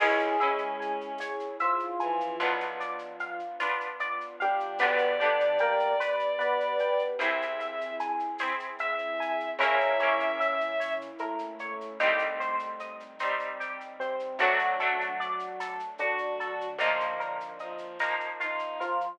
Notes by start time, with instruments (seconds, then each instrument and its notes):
0.00 electric bass (finger) C#2, electric piano 1 G#3 G#4, pad 2 (warm) C#4 E4 G#4, orchestral harp C#4 E4 G#4, violin E4, pizzicato strings C#5, crash
0.19 shaker
0.40 violin C#4, orchestral harp C#4 E4 G#4, pizzicato strings E5, shaker
0.58 shaker
0.80 pizzicato strings G#5, shaker
1.01 shaker
1.18 pizzicato strings C#5, tambourine, shaker
1.40 shaker
1.60 electric piano 1 F3 F4, pizzicato strings E5, shaker
1.79 shaker
2.00 violin E3, pizzicato strings G#5, shaker
2.20 shaker
2.38 electric bass (finger) B1, pad 2 (warm) B3 D4 F4, orchestral harp D4 F4, pizzicato strings B4, shaker
2.43 orchestral harp B3
2.60 shaker
2.80 pizzicato strings D5, shaker
2.99 shaker
3.19 pizzicato strings F5, shaker
3.39 shaker
3.60 orchestral harp B3 D4 F4, pizzicato strings B4, tambourine, shaker
3.81 shaker
4.00 pizzicato strings D5, shaker
4.21 shaker
4.40 electric piano 1 G3 G4, violin D4, pizzicato strings F5, shaker
4.60 shaker
4.78 electric bass (finger) G1, electric piano 1 B2 B3, pad 2 (warm) B3 D4 G4, orchestral harp D4 G4, pizzicato strings B4, violin D5, shaker
4.83 orchestral harp B3
4.98 shaker
5.20 electric piano 1 D3 D4, orchestral harp B3 D4 G4, pizzicato strings D5, shaker
5.40 shaker
5.58 electric piano 1 A#3 A#4, pizzicato strings G5, shaker
5.79 shaker
6.00 pizzicato strings B4, tambourine, shaker
6.20 shaker
6.39 electric piano 1 B3 B4, pizzicato strings D5, shaker
6.60 shaker
6.79 pizzicato strings G5, shaker
6.99 shaker
7.19 electric bass (finger) C2, pad 2 (warm) C4 E4 G#4, orchestral harp C4 E4 G#4, pizzicato strings C5, violin E5, shaker
7.42 shaker
7.60 pizzicato strings E5, shaker
7.81 shaker
8.00 pizzicato strings G#5, shaker
8.20 shaker
8.38 orchestral harp E4 G#4, pizzicato strings C5, tambourine, shaker
8.43 orchestral harp C4
8.60 shaker
8.79 violin E5, pizzicato strings E5, shaker
8.98 shaker
9.20 pizzicato strings G#5, shaker
9.40 shaker
9.59 electric bass (finger) A#1, electric piano 1 C#3 C#4, pad 2 (warm) A#3 C#4 E4, orchestral harp C#4 E4, pizzicato strings A#4, violin E5, shaker
9.63 orchestral harp A#3
9.80 shaker
9.99 orchestral harp A#3 C#4 E4, pizzicato strings C#5, shaker
10.20 shaker
10.40 pizzicato strings E5, shaker
10.61 shaker
10.80 pizzicato strings C#5, tambourine, shaker
11.01 shaker
11.19 electric piano 1 A2 A3, pizzicato strings A#4, shaker
11.39 shaker
11.59 pizzicato strings C#5, shaker
11.81 shaker
12.00 electric bass (finger) C2, pad 2 (warm) G3 C4 D#4, orchestral harp G3 C4 D#4, pizzicato strings G4, shaker
12.19 shaker
12.40 pizzicato strings C5, shaker
12.59 shaker
12.80 pizzicato strings D#5, shaker
13.00 shaker
13.19 orchestral harp G3 C4 D#4, pizzicato strings C5, tambourine, shaker
13.39 shaker
13.60 pizzicato strings G4, shaker
13.81 shaker
14.00 electric piano 1 C3 C4, pizzicato strings C5, shaker
14.20 shaker
14.39 electric bass (finger) D2, pad 2 (warm) F#3 A3 D4, electric piano 1 F#3 F#4, orchestral harp A3 D4, violin D4, pizzicato strings F#4, shaker
14.43 orchestral harp F#3
14.59 shaker
14.80 orchestral harp F#3 A3 D4, pizzicato strings A4, shaker
15.01 shaker
15.20 pizzicato strings D5, shaker
15.39 shaker
15.60 pizzicato strings A4, tambourine, shaker
15.80 shaker
15.98 electric piano 1 D3 D4, violin F#4, pizzicato strings F#4, shaker
16.18 shaker
16.40 pizzicato strings A4, shaker
16.61 shaker
16.79 electric bass (finger) A#1, pad 2 (warm) F3 A#3 D#4, violin A#3, orchestral harp A#3 D#4, pizzicato strings F4, shaker
16.83 orchestral harp F3
17.00 shaker
17.20 pizzicato strings A#4, shaker
17.40 shaker
17.59 violin F3, pizzicato strings D#5, shaker
17.78 shaker
18.00 orchestral harp F3 A#3 D#4, pizzicato strings A#4, tambourine, shaker
18.20 shaker
18.40 violin D#4, pizzicato strings F4, shaker
18.59 shaker
18.80 electric piano 1 F3 F4, pizzicato strings A#4, shaker
19.01 shaker